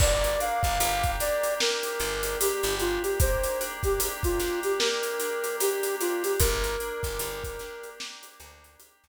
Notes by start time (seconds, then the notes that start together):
0.00 G1 A#3 D5, kick, crash
0.24 closed hi-hat
0.39 D4 F5, closed hi-hat
0.63 G1, kick, closed hi-hat
0.80 G1 G4, closed hi-hat
1.04 kick, closed hi-hat
1.20 D4 D5, snare, closed hi-hat
1.44 closed hi-hat
1.60 A#3 A#4, snare
1.83 closed hi-hat
2.00 G1 D4, closed hi-hat
2.23 closed hi-hat
2.40 G4, closed hi-hat
2.63 G1, closed hi-hat
2.80 D4 F4, closed hi-hat
3.03 G4, closed hi-hat
3.20 A#3 C5, kick, closed hi-hat
3.44 closed hi-hat
3.60 D4, closed hi-hat
3.83 G4, kick, closed hi-hat
4.00 G4, closed hi-hat
4.23 F4, kick, closed hi-hat
4.40 D4, snare, closed hi-hat
4.63 G4, closed hi-hat
4.79 A#3 A#4, snare
5.03 closed hi-hat
5.20 D4, closed hi-hat
5.44 closed hi-hat
5.60 G4, closed hi-hat
5.83 closed hi-hat
6.01 D4 F4, closed hi-hat
6.24 G4, closed hi-hat
6.39 G1 A#3 A#4, kick, closed hi-hat
6.64 closed hi-hat
6.80 D4, closed hi-hat
7.03 G1, kick, snare, closed hi-hat
7.19 G1 G4, closed hi-hat
7.44 kick, closed hi-hat
7.59 D4, snare, closed hi-hat
7.83 closed hi-hat
8.00 A#3, snare
8.23 closed hi-hat
8.40 D2 D4, closed hi-hat
8.64 closed hi-hat
8.79 G4, closed hi-hat
9.04 D2, closed hi-hat